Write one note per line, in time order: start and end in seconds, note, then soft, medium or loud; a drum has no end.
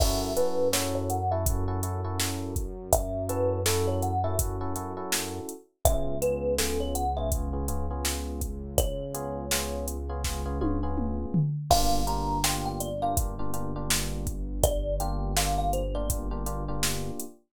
0.00 5.40 F#2 medium
0.00 0.31 C#4 medium
0.00 0.31 E4 medium
0.00 0.31 F#4 medium
0.00 0.31 A4 medium
0.00 0.34 E5 loud
0.00 kick loud
0.00 crash loud
0.36 0.67 C#4 medium
0.36 0.67 E4 medium
0.36 0.67 F#4 medium
0.36 0.67 A4 medium
0.36 0.68 B4 loud
0.36 closed hi-hat medium
0.73 1.18 C#4 medium
0.73 1.18 E4 medium
0.73 1.18 F#4 medium
0.73 1.18 A4 medium
0.73 0.94 C#5 medium
0.73 snare loud
0.95 1.09 C#5 loud
1.10 1.30 F#5 loud
1.10 closed hi-hat medium
1.31 1.44 C#4 medium
1.31 1.44 E4 medium
1.31 1.44 F#4 medium
1.31 1.44 A4 medium
1.31 1.46 E5 loud
1.46 1.64 C#4 medium
1.46 1.64 E4 medium
1.46 1.64 F#4 medium
1.46 1.64 A4 medium
1.46 kick loud
1.46 closed hi-hat loud
1.68 1.80 C#4 medium
1.68 1.80 E4 medium
1.68 1.80 F#4 medium
1.68 1.80 A4 medium
1.83 2.00 C#4 medium
1.83 2.00 E4 medium
1.83 2.00 F#4 medium
1.83 2.00 A4 medium
1.83 closed hi-hat medium
2.04 2.60 C#4 medium
2.04 2.60 E4 medium
2.04 2.60 F#4 medium
2.04 2.60 A4 medium
2.20 snare loud
2.56 kick loud
2.56 closed hi-hat medium
2.93 3.27 E5 loud
2.93 kick loud
2.93 closed hi-hat loud
3.29 3.60 C#4 medium
3.29 3.60 E4 medium
3.29 3.60 F#4 medium
3.29 3.60 A4 medium
3.29 3.61 B4 medium
3.29 closed hi-hat medium
3.66 4.12 C#4 medium
3.66 4.12 E4 medium
3.66 4.12 F#4 medium
3.66 3.86 A4 medium
3.66 4.12 A4 medium
3.66 snare loud
3.87 4.02 C#5 loud
4.02 4.23 F#5 loud
4.02 closed hi-hat medium
4.24 4.36 C#4 medium
4.24 4.36 E4 medium
4.24 4.36 F#4 medium
4.24 4.36 A4 medium
4.24 4.38 E5 loud
4.39 4.56 C#4 medium
4.39 4.56 E4 medium
4.39 4.56 F#4 medium
4.39 4.56 A4 medium
4.39 kick loud
4.39 closed hi-hat loud
4.61 4.73 C#4 medium
4.61 4.73 E4 medium
4.61 4.73 F#4 medium
4.61 4.73 A4 medium
4.76 4.93 C#4 medium
4.76 4.93 E4 medium
4.76 4.93 F#4 medium
4.76 4.93 A4 medium
4.76 closed hi-hat medium
4.97 5.53 C#4 medium
4.97 5.53 E4 medium
4.97 5.53 F#4 medium
4.97 5.53 A4 medium
5.12 snare loud
5.49 closed hi-hat medium
5.85 11.26 C#2 medium
5.85 6.15 B3 medium
5.85 6.15 C#4 medium
5.85 6.15 F4 medium
5.85 6.15 G#4 medium
5.85 6.18 E5 loud
5.85 kick loud
5.85 closed hi-hat loud
6.22 6.53 B3 medium
6.22 6.53 C#4 medium
6.22 6.53 F4 medium
6.22 6.53 G#4 medium
6.22 6.54 B4 loud
6.22 closed hi-hat medium
6.58 7.04 B3 medium
6.58 7.04 C#4 medium
6.58 7.04 F4 medium
6.58 7.04 G#4 medium
6.58 6.79 A4 loud
6.58 snare loud
6.80 6.95 C#5 medium
6.95 7.16 F#5 medium
6.95 closed hi-hat medium
7.17 7.29 B3 medium
7.17 7.29 C#4 medium
7.17 7.29 F4 medium
7.17 7.29 G#4 medium
7.17 7.31 E5 loud
7.32 7.49 B3 medium
7.32 7.49 C#4 medium
7.32 7.49 F4 medium
7.32 7.49 G#4 medium
7.32 kick loud
7.32 closed hi-hat medium
7.53 7.65 B3 medium
7.53 7.65 C#4 medium
7.53 7.65 F4 medium
7.53 7.65 G#4 medium
7.68 7.86 B3 medium
7.68 7.86 C#4 medium
7.68 7.86 F4 medium
7.68 7.86 G#4 medium
7.68 closed hi-hat medium
7.91 8.46 B3 medium
7.91 8.46 C#4 medium
7.91 8.46 F4 medium
7.91 8.46 G#4 medium
8.05 snare loud
8.41 kick medium
8.41 closed hi-hat medium
8.78 9.86 C#5 loud
8.78 kick loud
8.78 closed hi-hat loud
9.14 9.45 B3 medium
9.14 9.45 C#4 medium
9.14 9.45 F4 medium
9.14 9.45 G#4 medium
9.14 closed hi-hat medium
9.51 9.97 B3 medium
9.51 9.97 C#4 medium
9.51 9.97 F4 medium
9.51 9.97 G#4 medium
9.51 snare loud
9.88 closed hi-hat medium
10.09 10.21 B3 medium
10.09 10.21 C#4 medium
10.09 10.21 F4 medium
10.09 10.21 G#4 medium
10.24 10.41 B3 medium
10.24 10.41 C#4 medium
10.24 10.41 F4 medium
10.24 10.41 G#4 medium
10.24 kick medium
10.24 snare medium
10.46 10.57 B3 medium
10.46 10.57 C#4 medium
10.46 10.57 F4 medium
10.46 10.57 G#4 medium
10.61 10.79 B3 medium
10.61 10.79 C#4 medium
10.61 10.79 F4 medium
10.61 10.79 G#4 medium
10.61 high tom medium
10.83 11.39 B3 medium
10.83 11.39 C#4 medium
10.83 11.39 F4 medium
10.83 11.39 G#4 medium
10.98 mid tom medium
11.34 floor tom loud
11.70 17.11 G1 medium
11.70 12.01 A#3 medium
11.70 12.01 D4 medium
11.70 12.01 F4 medium
11.70 12.01 G4 medium
11.70 12.05 F5 loud
11.70 kick loud
11.70 crash loud
12.07 12.38 A#3 medium
12.07 12.38 D4 medium
12.07 12.38 F4 medium
12.07 12.38 G4 medium
12.07 12.43 A#5 medium
12.07 closed hi-hat medium
12.44 12.89 A#3 medium
12.44 12.89 D4 medium
12.44 12.89 F4 medium
12.44 12.89 G4 medium
12.44 12.65 G5 loud
12.44 snare loud
12.66 12.80 G5 loud
12.80 13.01 D5 loud
12.80 closed hi-hat medium
13.02 13.14 A#3 medium
13.02 13.14 D4 medium
13.02 13.14 F4 medium
13.02 13.14 G4 medium
13.02 13.16 F5 loud
13.17 13.34 A#3 medium
13.17 13.34 D4 medium
13.17 13.34 F4 medium
13.17 13.34 G4 medium
13.17 kick loud
13.17 closed hi-hat loud
13.39 13.51 A#3 medium
13.39 13.51 D4 medium
13.39 13.51 F4 medium
13.39 13.51 G4 medium
13.54 13.71 A#3 medium
13.54 13.71 D4 medium
13.54 13.71 F4 medium
13.54 13.71 G4 medium
13.54 closed hi-hat medium
13.76 14.32 A#3 medium
13.76 14.32 D4 medium
13.76 14.32 F4 medium
13.76 14.32 G4 medium
13.90 snare loud
14.27 kick medium
14.27 closed hi-hat medium
14.63 14.95 D5 loud
14.63 kick loud
14.63 closed hi-hat loud
15.00 15.31 A#3 medium
15.00 15.31 D4 medium
15.00 15.31 F4 medium
15.00 15.31 G4 medium
15.00 15.32 G5 loud
15.00 closed hi-hat medium
15.36 15.82 A#3 medium
15.36 15.82 D4 medium
15.36 15.82 F4 medium
15.36 15.82 G4 medium
15.36 15.57 F5 loud
15.36 snare loud
15.58 15.72 F5 loud
15.73 15.94 C5 loud
15.73 closed hi-hat medium
15.95 16.07 A#3 medium
15.95 16.07 D4 medium
15.95 16.07 F4 medium
15.95 16.07 G4 medium
15.95 16.09 D5 loud
16.10 16.27 A#3 medium
16.10 16.27 D4 medium
16.10 16.27 F4 medium
16.10 16.27 G4 medium
16.10 kick loud
16.10 closed hi-hat loud
16.31 16.43 A#3 medium
16.31 16.43 D4 medium
16.31 16.43 F4 medium
16.31 16.43 G4 medium
16.46 16.63 A#3 medium
16.46 16.63 D4 medium
16.46 16.63 F4 medium
16.46 16.63 G4 medium
16.46 closed hi-hat medium
16.68 17.24 A#3 medium
16.68 17.24 D4 medium
16.68 17.24 F4 medium
16.68 17.24 G4 medium
16.83 snare loud
17.20 closed hi-hat medium